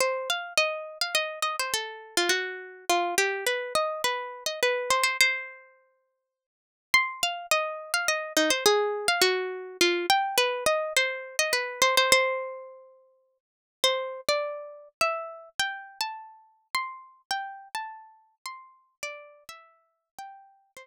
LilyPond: \new Staff { \time 3/4 \key c \minor \tempo 4 = 104 c''8 f''8 ees''8. f''16 ees''8 ees''16 c''16 | a'8. eis'16 fis'4 f'8 g'8 | b'8 ees''8 b'8. ees''16 b'8 c''16 c''16 | c''2~ c''8 r8 |
c'''8 f''8 ees''8. f''16 ees''8 ees'16 c''16 | aes'8. f''16 fis'4 f'8 g''8 | b'8 ees''8 c''8. ees''16 b'8 c''16 c''16 | c''2~ c''8 r8 |
\key c \major c''8. d''4~ d''16 e''4 | g''8. a''4~ a''16 c'''4 | g''8. a''4~ a''16 c'''4 | d''8. e''4~ e''16 g''4 |
c''2 r4 | }